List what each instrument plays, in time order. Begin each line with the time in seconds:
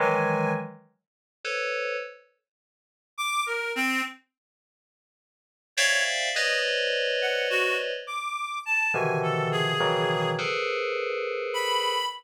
0.00 electric piano 2 D#3 E3 F#3 G#3, clarinet G#5
1.44 electric piano 2 A4 B4 C5 C#5
3.18 clarinet D6
3.46 clarinet A#4
3.75 clarinet C4
5.77 electric piano 2 C5 D5 E5 F5 G5, clarinet C#5
6.34 electric piano 2 B4 C5 C#5 D5 D#5, clarinet D#5
7.21 clarinet F#5
7.50 clarinet F#4
8.07 clarinet D6
8.66 clarinet A5
8.93 electric piano 2 B2 C3 D3 D#3 E3 F3, clarinet G#5
9.23 clarinet A4
9.52 clarinet G#4
9.80 electric piano 2 B2 C#3 D#3 E3 F#3
10.38 electric piano 2 G#4 A4 A#4 B4 C5
11.54 clarinet B5